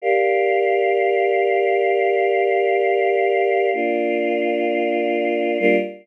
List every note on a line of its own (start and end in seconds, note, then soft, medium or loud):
0.02 3.70 G4 medium
0.02 3.70 A#4 medium
0.02 3.70 D5 medium
0.02 3.70 F5 medium
3.73 5.57 A#3 medium
3.73 5.57 D4 medium
3.73 5.57 F4 medium
5.60 5.76 G3 medium
5.60 5.76 A#3 loud
5.60 5.76 D4 loud
5.60 5.76 F4 loud